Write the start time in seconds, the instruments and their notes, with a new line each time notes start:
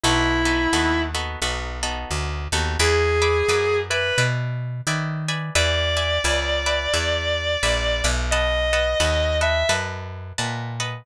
0.04 electric bass (finger) B1, acoustic guitar (steel) B3 D#4 F#4 A4, distortion guitar E4
0.45 acoustic guitar (steel) B3 D#4 F#4 A4
0.73 electric bass (finger) D#2, acoustic guitar (steel) B3 D#4 F#4 A4
1.15 acoustic guitar (steel) B3 D#4 F#4 A4
1.42 electric bass (finger) B1, acoustic guitar (steel) B3 D#4 F#4 A4
1.83 acoustic guitar (steel) B3 D#4 F#4 A4
2.11 electric bass (finger) D2
2.52 electric bass (finger) D#2, acoustic guitar (steel) B3 D#4 F#4 A4
2.79 electric bass (finger) E2, distortion guitar G#4, acoustic guitar (steel) B4 D5 E5 G#5
3.22 acoustic guitar (steel) B4 D5 E5 G#5
3.49 electric bass (finger) F#2, acoustic guitar (steel) B4 D5 E5 G#5
3.90 distortion guitar B4, acoustic guitar (steel) B4 D5 E5 G#5
4.18 electric bass (finger) B2, acoustic guitar (steel) B4 D5 E5 G#5
4.87 electric bass (finger) D#3, acoustic guitar (steel) B4 D5 E5 G#5
5.28 acoustic guitar (steel) B4 D5 E5 G#5
5.55 electric bass (finger) E2, acoustic guitar (steel) B4 D5 E5 G#5, distortion guitar D5
5.97 acoustic guitar (steel) B4 D5 E5 G#5
6.24 electric bass (finger) C#2, acoustic guitar (steel) B4 D5 E5 G#5
6.66 acoustic guitar (steel) B4 D5 E5 G#5
6.94 electric bass (finger) E2, acoustic guitar (steel) B4 D5 E5 G#5
7.63 electric bass (finger) A#1, acoustic guitar (steel) B4 D5 E5 G#5
8.04 electric bass (finger) B1, acoustic guitar (steel) B4 D5 E5 G#5
8.31 acoustic guitar (steel) B4 D#5 F#5 A5, distortion guitar D#5
8.73 acoustic guitar (steel) B4 D#5 F#5 A5
9.00 electric bass (finger) D#2, acoustic guitar (steel) B4 D#5 F#5 A5
9.41 acoustic guitar (steel) B4 D#5 F#5 A5, distortion guitar E5
9.69 electric bass (finger) F#2, acoustic guitar (steel) B4 D#5 F#5 A5
10.38 electric bass (finger) A#2, acoustic guitar (steel) B4 D#5 F#5 A5
10.80 acoustic guitar (steel) B4 D#5 F#5 A5